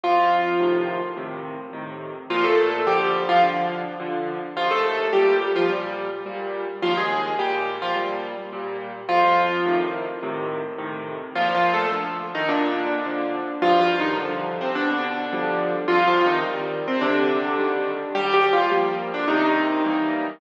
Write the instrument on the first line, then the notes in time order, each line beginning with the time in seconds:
acoustic grand piano
0.04 F2 F3 F4
0.60 A2 C3 D#3
1.17 A2 C3 D#3
1.73 A2 C3 D#3
2.30 A#2 F3 F4
2.44 A3 A4
2.87 D3 F3 G3 G4
3.29 F3 F4
3.43 D3 F3
4.00 D3 F3
4.56 D#2 F3 F4
4.71 A3 A4
5.13 A#2 G3 G4
5.56 F3 F4
5.70 A#2 G3
6.26 A#2 G3
6.82 D#2 F3 F4
6.97 G#3 G#4
7.39 A#2 G3 G4
7.82 F3 F4
7.96 A#2 G3
8.53 A#2 G3
9.09 F2 F3 F4
9.66 A2 C3 D#3
10.23 A2 C3 D#3
10.78 A2 C3 D#3
11.35 A#2 F3 F4
11.55 F3 F4
11.74 A3 A4
11.92 D3 F3
12.35 D#3 D#4
12.48 A#2 D3 D4
13.05 D3 F3
13.62 G2 F3 F4
13.81 F3 F4
14.00 D#3 D#4
14.18 C3 D3 F3
14.61 C3 C4
14.75 B2 D3 D4
15.33 D3 F3 G3
15.88 C3 F3 F4
16.08 F3 F4
16.26 D#3 D#4
16.45 D#3 G3
16.88 C3 C4
17.01 C3 D3 D4
17.58 D#3 G3
18.15 D#2 G3 G4
18.34 G3 G4
18.53 F3 F4
18.71 F3 G3 A#3
19.14 D3 D4
19.28 C3 D#3 D#4
19.85 E3 G3 A#3